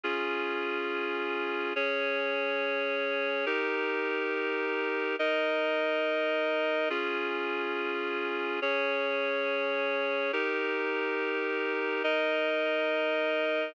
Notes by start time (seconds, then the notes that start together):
0.03 C#4 F4 G#4
1.76 C#4 G#4 C#5
3.46 D#4 G4 A#4
5.19 D#4 A#4 D#5
6.90 C#4 F4 G#4
8.62 C#4 G#4 C#5
10.33 D#4 G4 A#4
12.04 D#4 A#4 D#5